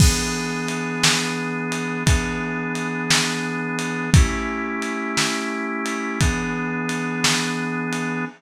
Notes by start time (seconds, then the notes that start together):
0.00 E3 B3 D4 G#4, kick, crash
0.69 ride
1.03 snare
1.72 ride
2.06 E3 B3 D4 G#4, kick, ride
2.75 ride
3.10 snare
3.79 ride
4.14 A3 C#4 E4 G4, kick, ride
4.82 ride
5.17 snare
5.86 ride
6.21 E3 B3 D4 G#4, kick, ride
6.89 ride
7.24 snare
7.93 ride